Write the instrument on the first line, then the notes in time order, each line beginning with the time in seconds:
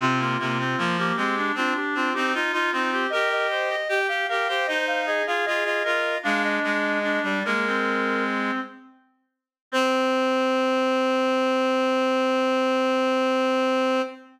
clarinet
0.01 C3 C4 F4
0.19 A#3 F4
0.39 C3 A#3
0.59 C4
0.78 F3 A#3
0.98 A#3 G4
1.16 G#3 C4 G4
1.37 D4
1.55 C4 D4 F4
1.76 G4
1.95 C4 F4
2.13 C4 D#4 G4
2.34 D#4 F4
2.52 D#4 F4
2.72 C4 D#4 F4
2.92 G4
3.10 G4 A#4 D#5
3.32 D#5
3.50 C5
3.69 D#5
3.89 G4
4.08 G4 F5
4.29 G4 A#4 F5
4.48 G4 C5
4.67 D#4 C5 D#5
4.87 F5
5.06 G#4 D#5
5.27 F4 G#4 F5
5.45 F4 G#4 D#5
5.65 F4 D#5
5.84 F4 A#4 D#5
6.23 G#3 D4 F5
6.44 D#5
6.63 G#3 D#5
7.03 D4
7.23 G3 D5
7.45 G#3 A#3 A#4
7.67 C4
9.72 C4 C5